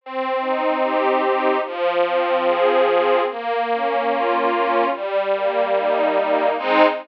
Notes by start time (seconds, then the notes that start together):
0.01 C4
0.41 D#4
0.83 G4
1.22 D#4
1.65 F3
2.05 C4
2.46 G#4
2.88 C4
3.29 A#3
3.70 C#4
4.12 F4
4.51 C#4
4.92 G3
5.34 A#3
5.76 D#4
6.17 A#3
6.58 G#3 C4 D#4